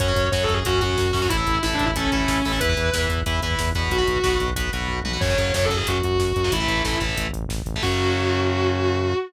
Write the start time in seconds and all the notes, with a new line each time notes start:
0.00 F#2 C#4 F#4 C#5, kick, closed hi-hat
0.08 C#4 F#4, kick
0.16 F#2, kick, closed hi-hat
0.25 kick
0.32 F#2 C#4 F#4 C#5, kick, snare
0.41 A4, kick
0.49 F#2, kick, closed hi-hat
0.54 G#4, kick
0.65 F#2 C#4 F#4, kick, closed hi-hat
0.74 kick
0.81 F#2 C#4 F#4, kick, closed hi-hat
0.90 kick
0.98 F#2, kick, snare
1.06 kick
1.13 F#2 C#4 F#4, kick, open hi-hat
1.22 C#4 F#4, kick
1.29 A1 E4 A4, kick, closed hi-hat
1.37 E4 A4, kick
1.46 A1, kick, closed hi-hat
1.55 kick
1.63 A1 E4 A4, kick, snare
1.71 D4, kick
1.79 A1, kick, closed hi-hat
1.85 E4, kick
1.94 A1 C#4 E4 A4, kick, closed hi-hat
2.04 kick
2.12 A1 C#4 E4 A4, kick, closed hi-hat
2.20 kick
2.28 A1, kick, snare
2.36 kick
2.45 A1 E4 A4, kick, open hi-hat
2.52 E4 A4, kick
2.60 E2 E4 B4, kick, closed hi-hat
2.69 E4 B4, kick
2.77 E2, kick, closed hi-hat
2.85 kick
2.93 E2 E4 B4, kick, snare
3.02 kick
3.09 E2, kick, closed hi-hat
3.18 kick
3.26 E2 E4 B4, kick, closed hi-hat
3.34 kick
3.42 E2 E4 B4, kick, closed hi-hat
3.51 kick
3.59 E2, kick, snare
3.67 kick
3.75 E2 F#4 B4, kick, closed hi-hat
3.83 kick
3.90 B1 F#4, kick, closed hi-hat
3.98 F#4 B4, kick
4.07 B1, kick, closed hi-hat
4.16 kick
4.24 B1 F#4 B4, kick, snare
4.32 kick
4.40 B1, kick, closed hi-hat
4.48 kick
4.56 B1 F#4 B4, kick, closed hi-hat
4.65 kick
4.73 B1 F#4 B4, kick, closed hi-hat
4.81 kick
4.88 B1, kick, floor tom
5.04 B1 F#4 B4, high tom
5.13 F#4 B4
5.21 F#2 C#3 F#3 C#5, kick, crash
5.30 C#3 F#3, kick
5.38 F#2 C#3 F#3, kick, closed hi-hat
5.46 kick
5.54 F#2 C#3 F#3 C#5, kick, snare
5.62 A4, kick
5.69 F#2 C#3 F#3, kick, closed hi-hat
5.76 G#4, kick
5.87 F#2 F#4, kick, closed hi-hat
5.95 kick
6.03 F#2 F#4, kick, closed hi-hat
6.11 kick
6.19 F#2, kick, snare
6.28 kick
6.36 F#2, kick, closed hi-hat
6.44 C#3 F#3, kick
6.52 A1 E3 A3 E4, kick, closed hi-hat
6.60 E3 A3, kick
6.68 A1 E3 A3, kick, closed hi-hat
6.77 kick
6.84 A1 E3 A3, kick, snare
6.93 kick
7.00 A1 E3 A3, kick, closed hi-hat
7.09 kick
7.17 A1, kick, closed hi-hat
7.26 kick
7.32 A1, kick, closed hi-hat
7.42 kick
7.49 A1, kick, snare
7.58 kick
7.66 A1, kick, closed hi-hat
7.74 E3 A3, kick
7.83 F#2 C#3 F#3 F#4, kick, crash